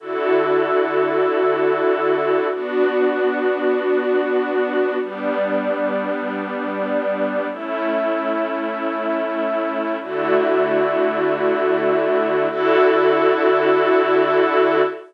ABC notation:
X:1
M:4/4
L:1/8
Q:1/4=96
K:D
V:1 name="String Ensemble 1"
[D,EFA]8 | [B,DF]8 | [G,B,D]8 | [A,CE]8 |
[D,A,EF]8 | [D,EFA]8 |]